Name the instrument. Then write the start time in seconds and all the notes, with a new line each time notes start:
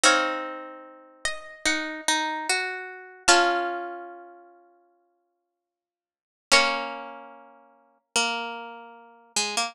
pizzicato strings
0.04 C4 D#4 C#5 F5
1.25 D#5
1.66 D#4 F#5
2.08 D#4
2.49 F#4
3.28 C#4 F4 F5 A5
6.52 A#3 C#4 A#4 C#5
8.16 A#3
9.36 G#3
9.57 A#3